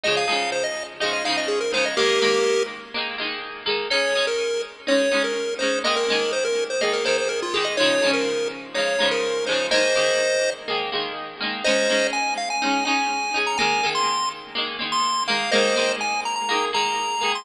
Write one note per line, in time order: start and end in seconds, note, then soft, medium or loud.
0.04 0.26 F3 medium
0.04 0.26 G#3 medium
0.04 0.26 D#4 medium
0.04 0.16 D#5 medium
0.08 0.26 C#3 medium
0.17 0.50 F5 medium
0.28 0.94 F3 medium
0.28 0.94 G#3 medium
0.28 0.94 D#4 medium
0.32 0.94 C#3 medium
0.52 0.64 C5 medium
0.64 0.83 D#5 medium
1.00 1.23 F3 medium
1.00 1.23 G#3 medium
1.00 1.23 D#4 medium
1.00 1.12 D#5 medium
1.05 1.23 C#3 medium
1.13 1.24 D#5 medium
1.24 1.69 F3 medium
1.24 1.69 G#3 medium
1.24 1.69 D#4 medium
1.24 1.37 F5 medium
1.29 1.69 C#3 medium
1.37 1.49 D#5 medium
1.48 1.59 G#4 medium
1.61 1.72 A#4 medium
1.72 1.95 F3 medium
1.72 1.95 G#3 medium
1.72 1.95 D#4 medium
1.72 1.85 C5 medium
1.77 1.95 C#3 medium
1.85 1.97 D#5 medium
1.97 2.19 D#3 medium
1.97 2.19 G#3 medium
1.97 2.19 A#3 medium
1.97 2.63 G4 medium
1.97 2.63 A#4 medium
2.22 2.88 D#3 medium
2.22 2.88 G#3 medium
2.22 2.88 A#3 medium
2.94 3.17 D#3 medium
2.94 3.17 G#3 medium
2.94 3.17 A#3 medium
3.18 3.63 D#3 medium
3.18 3.63 G#3 medium
3.18 3.63 A#3 medium
3.66 3.88 D#3 medium
3.66 3.88 G#3 medium
3.66 3.88 A#3 medium
3.90 4.13 G#3 medium
3.90 4.13 C#4 medium
3.90 4.13 D#4 medium
3.90 4.26 C#5 medium
4.15 4.82 G#3 medium
4.15 4.82 C#4 medium
4.15 4.82 D#4 medium
4.27 4.62 A#4 medium
4.87 5.09 G#3 medium
4.87 5.09 C#4 medium
4.87 5.09 D#4 medium
4.87 5.23 C#5 medium
5.11 5.56 G#3 medium
5.11 5.56 C#4 medium
5.11 5.56 D#4 medium
5.24 5.54 A#4 medium
5.59 5.83 C#4 medium
5.59 5.83 D#4 medium
5.59 5.79 C5 medium
5.63 5.83 G#3 medium
5.84 6.06 D#3 medium
5.84 6.06 G#3 medium
5.84 6.06 A#3 medium
5.84 5.96 D#5 medium
5.96 6.32 A#4 medium
6.08 6.75 D#3 medium
6.08 6.75 G#3 medium
6.08 6.75 A#3 medium
6.33 6.44 C5 medium
6.45 6.64 A#4 medium
6.70 6.81 C5 medium
6.81 7.03 D#3 medium
6.81 7.03 G#3 medium
6.81 7.03 A#3 medium
6.81 6.93 D#5 medium
6.93 7.05 A#4 medium
7.05 7.49 D#3 medium
7.05 7.49 G#3 medium
7.05 7.49 A#3 medium
7.05 7.17 C5 medium
7.18 7.29 C5 medium
7.29 7.40 A#4 medium
7.42 7.54 F4 medium
7.54 7.76 D#3 medium
7.54 7.76 G#3 medium
7.54 7.76 A#3 medium
7.54 7.65 G#4 medium
7.65 7.76 D#5 medium
7.77 8.00 F3 medium
7.77 8.00 G#3 medium
7.77 8.00 D#4 medium
7.77 8.11 C#5 medium
7.82 8.00 C#3 medium
8.02 8.69 F3 medium
8.02 8.69 G#3 medium
8.02 8.69 D#4 medium
8.06 8.69 C#3 medium
8.13 8.48 A#4 medium
8.74 8.97 F3 medium
8.74 8.97 G#3 medium
8.74 8.97 D#4 medium
8.74 9.09 C#5 medium
8.79 8.97 C#3 medium
8.99 9.43 F3 medium
8.99 9.43 G#3 medium
8.99 9.43 D#4 medium
9.03 9.43 C#3 medium
9.11 9.45 A#4 medium
9.46 9.70 F3 medium
9.46 9.70 G#3 medium
9.46 9.70 D#4 medium
9.46 9.67 C5 medium
9.52 9.70 C#3 medium
9.71 9.93 D#3 medium
9.71 9.93 G#3 medium
9.71 9.93 A#3 medium
9.71 10.50 C5 medium
9.71 10.50 D#5 medium
9.95 10.62 D#3 medium
9.95 10.62 G#3 medium
9.95 10.62 A#3 medium
10.68 10.90 D#3 medium
10.68 10.90 G#3 medium
10.68 10.90 A#3 medium
10.92 11.36 D#3 medium
10.92 11.36 G#3 medium
10.92 11.36 A#3 medium
11.40 11.63 D#3 medium
11.40 11.63 G#3 medium
11.40 11.63 A#3 medium
11.64 11.87 G#3 medium
11.64 11.87 C#4 medium
11.64 11.87 D#4 medium
11.64 12.07 C5 medium
11.64 12.07 D#5 medium
11.89 12.55 G#3 medium
11.89 12.55 C#4 medium
11.89 12.55 D#4 medium
12.13 12.34 G#5 medium
12.38 12.49 F5 medium
12.50 12.84 G#5 medium
12.62 12.84 G#3 medium
12.62 12.84 C#4 medium
12.62 12.84 D#4 medium
12.85 13.30 G#3 medium
12.85 13.30 C#4 medium
12.85 13.30 D#4 medium
12.85 13.39 G#5 medium
13.34 13.56 G#3 medium
13.34 13.56 C#4 medium
13.34 13.56 D#4 medium
13.47 13.58 A#5 medium
13.58 13.81 G#3 medium
13.58 13.81 A#3 medium
13.58 13.90 G#5 medium
13.62 13.81 D#3 medium
13.83 14.50 D#3 medium
13.83 14.50 G#3 medium
13.83 14.50 A#3 medium
13.95 14.29 C6 medium
14.55 14.77 D#3 medium
14.55 14.77 G#3 medium
14.55 14.77 A#3 medium
14.79 15.23 D#3 medium
14.79 15.23 G#3 medium
14.79 15.23 A#3 medium
14.92 15.24 C6 medium
15.28 15.50 D#3 medium
15.28 15.50 G#3 medium
15.28 15.50 A#3 medium
15.28 15.51 F5 medium
15.51 15.74 D#3 medium
15.51 15.74 G#3 loud
15.51 15.74 A#3 medium
15.51 15.93 C5 medium
15.51 15.93 D#5 medium
15.76 16.43 D#3 medium
15.76 16.43 G#3 medium
15.76 16.43 A#3 medium
16.01 16.21 G#5 medium
16.25 16.35 A#5 medium
16.36 16.65 A#5 medium
16.49 16.71 D#3 medium
16.49 16.71 G#3 medium
16.49 16.71 A#3 medium
16.73 17.17 D#3 medium
16.73 17.17 G#3 medium
16.73 17.17 A#3 medium
16.73 17.32 A#5 medium
17.21 17.43 D#3 medium
17.21 17.43 G#3 medium
17.21 17.43 A#3 medium
17.35 17.45 C6 medium